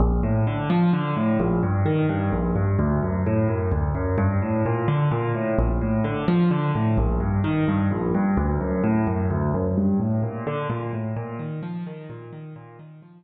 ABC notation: X:1
M:3/4
L:1/8
Q:1/4=129
K:Bb
V:1 name="Acoustic Grand Piano" clef=bass
B,,, A,, D, F, D, A,, | B,,, G,, E, G,, B,,, G,, | D,, ^F,, A,, F,, D,, F,, | G,, A,, B,, D, B,, A,, |
B,,, A,, D, F, D, A,, | B,,, G,, E, G,, B,,, G,, | D,, ^F,, A,, F,, D,, F,, | G,, A,, B,, D, B,, A,, |
B,, E, F, E, B,, E, | B,, E, F, z3 |]